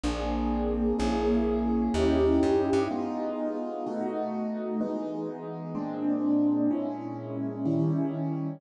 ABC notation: X:1
M:4/4
L:1/8
Q:"Swing" 1/4=126
K:G#m
V:1 name="Acoustic Grand Piano"
[A,^B,=DG]4 | [A,CEG]4 [CDE=G]4 | [G,B,D^E]4 [B,,=A,DF]4 | [E,G,B,D]4 [A,,G,^B,=D]4 |
[A,,G,CE]4 [D,=G,CE]4 |]
V:2 name="Electric Bass (finger)" clef=bass
A,,,4 | A,,,4 D,,2 F,, =G,, | z8 | z8 |
z8 |]